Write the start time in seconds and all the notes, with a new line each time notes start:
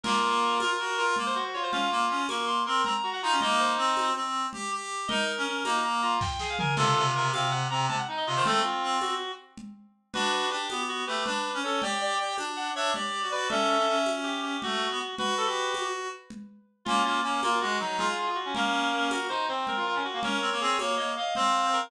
0.04 A#3 F4 A#4, crash, low conga
0.60 F4 A#4, tambourine, high conga
0.79 F#4
0.97 F4 A#4
1.16 A#3, low conga
1.26 C5
1.35 F#4 C5
1.54 F4 C#5
1.63 C5
1.72 C#4 F4 F5, low conga
1.91 A#3
2.09 C#4
2.28 A#3 A#4 C#6, tambourine, high conga
2.47 C6
2.66 C4 A#4 C6
2.85 C4 A#5, low conga
3.03 F#4
3.13 F#5
3.22 D#4 F4 A#5
3.32 C#4
3.41 A#3 D#4 D#5, low conga
3.59 C5
3.77 C4
3.97 tambourine, high conga
4.15 C4
4.53 G4, low conga
4.72 G4
5.08 D#4 A#4 D#5, low conga
5.37 C#4
5.46 C#4
5.64 A#3 D#4 A#5, tambourine, high conga
5.84 A#5
6.02 F4 A#5
6.21 G5, kick, snare
6.39 G#4, snare
6.49 F5
6.58 A#4 G#5, floor tom
6.76 C3 F4 A4, crash, low conga
6.96 C3
7.15 C3 A#4
7.33 C3 C4 F5, tambourine, high conga
7.51 F#5
7.70 C3 C4 A#5
7.89 C3 A5, low conga
7.99 F#5
8.08 D#4
8.17 D#5
8.27 C3 F4 D#5
8.36 D#3 C5
8.45 A3 C4 A4, low conga
8.63 F4
8.83 C4
9.01 F#4, tambourine, high conga
9.57 low conga
10.13 D4 F#4 B4, low conga
10.32 B4
10.50 D4 G4
10.69 B3, tambourine, high conga
10.89 F#4
11.07 A3 G4 B4
11.26 D4 B4, low conga
11.54 C#4
11.63 C#4 A4 C#5
11.82 G4 D5 G5, low conga
12.01 D5
12.19 G4
12.38 D4, tambourine, high conga
12.56 F#5
12.75 D4 C#5 E5
12.94 G4 D5, low conga
13.22 F#4
13.31 F#4 B4 D5
13.49 C#4 A4 E5, low conga
13.69 C#4
13.78 C#4
13.88 C#4
14.06 tambourine, high conga
14.24 G4
14.43 G4
14.62 A3 F#4, low conga
14.90 B3
14.99 F#4
15.18 F#4 B4, low conga
15.38 A4
15.47 G4
15.74 tambourine, high conga
16.30 low conga
16.85 A#3 C#4 F4, low conga
17.05 A#3 F4
17.23 A#3 C#4
17.42 A#3 F4 A#4, tambourine, high conga
17.61 G#3 F#4
17.79 F#3 D#4
17.98 F4 G#4, low conga
18.08 F4
18.17 F4
18.27 F4
18.35 F#4
18.45 C#4
18.55 A#3 C#4 A#4, low conga
18.92 A#3
19.09 F#4 A#4, tambourine, high conga
19.29 D#4 C5
19.48 C4 C5
19.67 A#4, low conga
19.76 F4
19.86 F4
19.95 C#4
20.05 F#4
20.14 A#3
20.23 C#4 A#4 C#5, low conga
20.41 C4
20.51 A#3
20.60 C4 G#4
20.78 A#3 C#5, tambourine, high conga
20.97 A#3 D#5
21.16 D#5 F5
21.35 C4 C5 F5, low conga
21.73 A#4